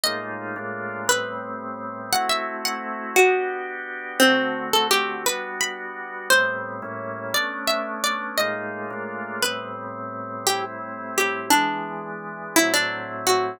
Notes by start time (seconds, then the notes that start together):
0.03 A2 G#3 A#3 D#4 F4 D#5
0.56 A2 G#3 A#3 D4 F4
1.08 A2 G3 B3 C4 B4
2.12 A3 C4 E4 F#4 F#5
2.29 E5
2.65 F#5
3.16 B3 D4 F#4 G4
4.20 D3 A3 C4 F#4
4.73 A4
4.91 G4
5.25 G3 B3 D4 F#4 B4
5.61 B5
6.30 A2 G3 B3 C4 C5
6.82 A2 G3 A#3 C#4 E4
7.34 A3 B3 C#4 D4 D5
7.67 E5
8.04 D5
8.38 A2 G#3 A#3 D#4 F4 D#5
8.90 A2 G#3 A#3 D4 F4
9.42 A2 G3 B3 C4 B4
10.47 A2 G3 C4 E4 G4
11.18 G4
11.50 E3 G#3 B3 D4
12.56 A2 F#3 C4 E4
12.74 D4
13.27 F#4